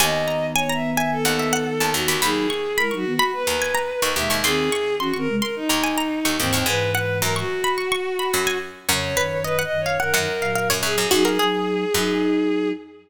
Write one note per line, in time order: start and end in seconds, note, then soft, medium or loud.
0.00 0.95 D#2 medium
0.00 2.17 D#3 medium
0.00 2.17 B3 loud
0.00 0.47 D#5 loud
0.00 0.25 G#5 medium
0.28 0.54 A#5 medium
0.55 0.72 C#5 loud
0.55 0.69 G#5 medium
0.69 0.91 E5 medium
0.69 0.95 A#5 medium
0.93 1.11 E5 loud
0.97 1.23 G#5 medium
1.12 1.91 A4 loud
1.25 1.74 D#2 medium
1.25 1.38 F#5 medium
1.39 1.53 E5 medium
1.53 1.66 F#5 medium
1.80 1.94 D#2 medium
1.80 2.03 A5 medium
1.93 2.07 D#2 medium
1.93 2.19 F#4 loud
2.08 2.21 D#2 medium
2.08 2.21 B5 medium
2.22 3.20 D#2 medium
2.22 2.47 F#3 medium
2.22 2.47 D#4 loud
2.22 2.77 G#4 loud
2.22 2.46 B5 medium
2.50 2.75 C#6 medium
2.76 2.92 G#3 medium
2.76 2.92 E4 medium
2.76 2.94 A#4 loud
2.76 2.91 B5 medium
2.91 3.05 F#3 medium
2.91 3.05 D#4 medium
2.91 3.14 C#6 medium
2.95 3.13 F#4 loud
3.06 3.19 D#3 medium
3.06 3.19 B3 medium
3.14 3.31 F#4 loud
3.19 3.43 B5 medium
3.33 4.13 B4 loud
3.47 3.93 D#2 medium
3.47 3.60 A#5 medium
3.62 3.75 G#5 medium
3.75 3.88 A#5 medium
4.02 4.15 D#2 medium
4.02 4.29 C#6 medium
4.16 4.29 D#2 medium
4.16 4.42 B2 medium
4.16 4.42 G#3 medium
4.16 4.38 E5 loud
4.30 4.43 D#2 medium
4.30 4.43 C#6 medium
4.43 5.51 D#2 medium
4.43 4.69 D#3 loud
4.43 4.69 C4 loud
4.43 4.95 G#4 loud
4.43 4.69 C6 medium
4.72 4.97 C#6 medium
4.99 5.13 E3 medium
4.99 5.13 C#4 medium
4.99 5.16 F#4 loud
4.99 5.13 C6 medium
5.14 5.28 D#3 medium
5.14 5.28 C4 medium
5.14 5.41 C#6 medium
5.18 5.36 A#4 loud
5.28 5.41 C3 medium
5.28 5.41 G#3 medium
5.38 5.55 A#4 loud
5.42 5.65 C6 medium
5.56 6.37 D#4 loud
5.69 6.20 D#2 medium
5.69 5.83 A#5 medium
5.84 5.97 G#5 medium
5.98 6.11 A#5 medium
6.25 6.38 D#2 medium
6.25 6.47 C#6 medium
6.38 6.53 D#2 medium
6.38 6.63 G#2 medium
6.38 6.63 E3 medium
6.38 6.65 C4 loud
6.53 6.67 D#2 medium
6.53 6.66 C#6 medium
6.66 7.18 G#2 medium
6.66 7.44 G#2 loud
6.66 7.44 E3 loud
6.66 6.91 B4 loud
6.66 6.92 G#5 medium
6.94 7.19 B4 loud
6.94 7.21 F#5 medium
7.22 8.23 F#2 medium
7.22 7.35 A#4 loud
7.22 7.35 A#5 medium
7.36 8.58 F#4 loud
7.36 7.61 C#6 medium
7.64 7.77 B5 medium
7.78 7.91 C#6 medium
7.92 8.18 C#6 medium
8.19 8.32 B5 medium
8.33 8.87 F#2 medium
8.33 8.47 B5 medium
8.47 8.71 G#5 medium
8.89 9.16 F2 medium
8.89 9.94 F#2 medium
8.89 9.16 C#3 loud
8.89 9.11 C#5 medium
8.89 9.42 C#5 loud
9.17 9.65 F#2 medium
9.17 9.65 D#3 medium
9.17 9.40 B4 medium
9.44 9.61 B4 loud
9.44 9.58 D#5 medium
9.59 9.86 F#5 medium
9.63 9.81 D#5 loud
9.71 9.98 F#2 medium
9.71 9.98 D#3 medium
9.80 9.98 C#5 loud
9.86 9.99 F5 medium
9.99 10.13 F#2 medium
9.99 10.13 D#3 medium
9.99 10.78 A#4 loud
9.99 10.13 F#5 medium
10.14 10.65 F#2 medium
10.14 10.28 F#2 medium
10.14 10.28 D#3 loud
10.14 10.41 F#5 medium
10.41 11.06 A#2 medium
10.41 11.06 F#3 medium
10.41 10.55 F5 medium
10.55 10.69 F5 medium
10.70 10.82 F#2 medium
10.70 10.93 C#5 medium
10.83 10.96 F#2 medium
10.83 11.07 G#4 loud
10.98 11.11 F#2 medium
11.11 11.38 F#2 medium
11.11 11.38 F#3 loud
11.11 11.38 D#4 loud
11.11 11.24 F#4 medium
11.11 12.69 G#4 loud
11.25 11.38 A#4 medium
11.39 11.85 F#3 medium
11.39 11.85 D#4 medium
11.39 13.09 G#4 medium
11.94 12.73 F#2 medium
11.94 12.72 F#3 medium
11.94 12.72 D#4 medium